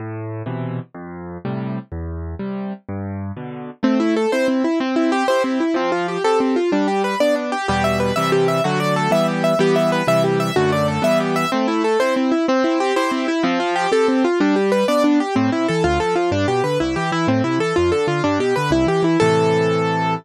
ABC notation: X:1
M:6/8
L:1/8
Q:3/8=125
K:Am
V:1 name="Acoustic Grand Piano"
z6 | z6 | z6 | z6 |
C E A c C E | C E G c C E | C F G A C F | D G B d D G |
[K:Em] G e B e G e | F d A e G e | G e B e G e | F d A e G e |
[K:Am] C E A c C E | C E G c C E | C F G A C F | D G B d D G |
C E A F A F | D G B E G E | C E A F A F | D G B E G E |
A6 |]
V:2 name="Acoustic Grand Piano"
A,,3 [B,,C,E,]3 | F,,3 [A,,C,G,]3 | E,,3 [C,G,]3 | G,,3 [B,,D,]3 |
A,3 [CE]3 | C3 [EG]3 | F,3 [CGA]3 | G,3 [B,D]3 |
[K:Em] [E,,B,,G,]3 [C,E,G,]3 | [D,F,A,]3 [E,G,B,]3 | [E,G,B,]3 [C,E,G,]3 | [F,,D,A,]3 [E,G,B,]3 |
[K:Am] A,3 [CE]3 | C3 [EG]3 | F,3 [CGA]3 | G,3 [B,D]3 |
A,, C, E, D,, F, F, | G,, B,, D, C,, E, E, | A,, C, E, F,, D, D, | G,, B,, D, C,, E, E, |
[A,,C,E,]6 |]